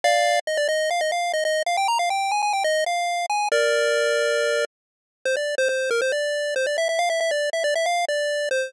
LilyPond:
\new Staff { \time 4/4 \key ees \major \tempo 4 = 138 <d'' f''>4 ees''16 d''16 ees''8 f''16 ees''16 f''8 ees''16 ees''8 f''16 | g''16 bes''16 f''16 g''8 aes''16 aes''16 g''16 ees''8 f''4 aes''8 | <bes' d''>2. r4 | \key f \major c''16 d''8 c''16 c''8 bes'16 c''16 d''4 c''16 d''16 e''16 e''16 |
f''16 e''16 e''16 d''8 e''16 d''16 e''16 f''8 d''4 c''8 | }